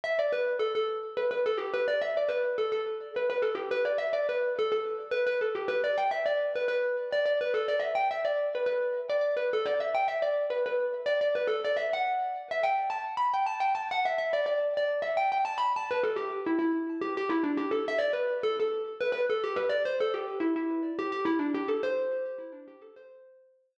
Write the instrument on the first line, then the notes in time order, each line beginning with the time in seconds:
xylophone
0.04 E5
0.19 D5
0.33 B4
0.59 A4
0.75 A4
1.17 B4
1.31 B4
1.46 A4
1.57 G4
1.74 B4
1.88 D5
2.02 E5
2.17 D5
2.29 B4
2.58 A4
2.72 A4
3.16 B4
3.30 B4
3.42 A4
3.55 G4
3.71 B4
3.85 D5
3.98 E5
4.13 D5
4.29 B4
4.59 A4
4.72 A4
5.11 B4
5.27 B4
5.41 A4
5.55 G4
5.68 B4
5.84 D5
5.98 G5
6.11 E5
6.26 D5
6.56 B4
6.68 B4
7.13 D5
7.26 D5
7.41 B4
7.54 A4
7.68 D5
7.80 E5
7.95 G5
8.11 E5
8.25 D5
8.55 B4
8.66 B4
9.10 D5
9.21 D5
9.37 B4
9.53 A4
9.66 D5
9.80 E5
9.95 G5
10.08 E5
10.22 D5
10.50 B4
10.66 B4
11.06 D5
11.21 D5
11.35 B4
11.48 A4
11.65 D5
11.77 E5
11.93 F#5
12.51 E5
12.63 G5
12.90 A5
13.17 B5
13.34 G5
13.46 A5
13.60 G5
13.75 A5
13.91 F#5
14.05 E5
14.18 E5
14.33 D5
14.46 D5
14.77 D5
15.02 E5
15.17 G5
15.32 G5
15.45 A5
15.58 B5
15.76 A5
15.91 B4
16.04 A4
16.16 G4
16.46 E4
16.59 E4
17.02 G4
17.17 G4
17.29 E4
17.44 D4
17.57 G4
17.71 A4
17.88 E5
17.99 D5
18.13 B4
18.43 A4
18.60 A4
19.01 B4
19.12 B4
19.30 A4
19.44 G4
19.56 B4
19.69 D5
19.85 C5
20.00 A4
20.14 G4
20.40 E4
20.56 E4
20.99 G4
21.12 G4
21.25 E4
21.39 D4
21.54 G4
21.68 A4
21.83 C5